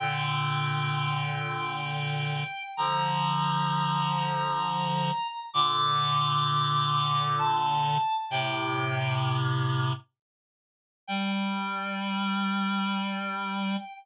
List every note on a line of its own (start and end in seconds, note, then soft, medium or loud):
0.00 2.44 A#2 medium
0.00 2.44 D3 medium
0.00 2.63 G5 loud
2.77 5.11 D3 medium
2.77 5.11 F3 medium
2.77 5.27 A#5 loud
5.54 7.98 A#2 loud
5.54 7.98 D3 loud
5.54 7.21 D6 loud
7.38 8.13 A5 loud
8.30 9.93 A2 medium
8.30 9.93 C3 loud
8.30 9.13 G5 loud
11.08 13.77 G3 loud
11.08 13.76 G5 loud